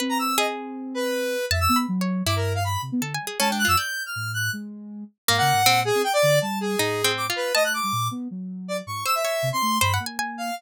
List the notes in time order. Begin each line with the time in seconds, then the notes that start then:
0.00 C4 B4
0.09 A#5
0.19 E6
0.38 G#4 D#5
0.94 B4
1.51 F2 E5 A5
1.60 E6
1.69 B3
1.76 B5
1.88 F#3
2.01 C#5
2.26 G2 E4 D6
2.36 A#4
2.55 F5
2.64 B5
2.82 C3
2.92 B3
3.01 D3 A4
3.14 G#5
3.20 G3
3.27 G#4
3.40 G#3 C#4 A5
3.49 D4 G5
3.59 F#6
3.65 F#2 F4 E6
3.77 D5 G6
4.06 F6
4.16 A2
4.34 F#6
4.53 G#3
5.28 G#2 A#3 F5
5.38 C#3 F#5
5.53 G#2
5.66 A#2 C4
5.85 G#4
5.95 C4
6.04 G5
6.13 D5
6.23 D3
6.42 G3 A5
6.61 G#4
6.79 A2 D#4
7.04 C4
7.17 D6
7.30 F4
7.36 B4
7.55 A3 D#5 A5
7.64 F#6
7.74 D6
7.83 G3
7.92 A#2
8.11 B3
8.31 F#3
8.68 D5
8.87 G#2 C#6
9.06 C5 E6
9.15 E5
9.25 C#5
9.43 C3
9.53 C4 C6
9.62 A3
9.81 G2 C5 B5
9.94 F#5
10.00 A#3
10.06 G#5
10.19 G#5
10.38 F5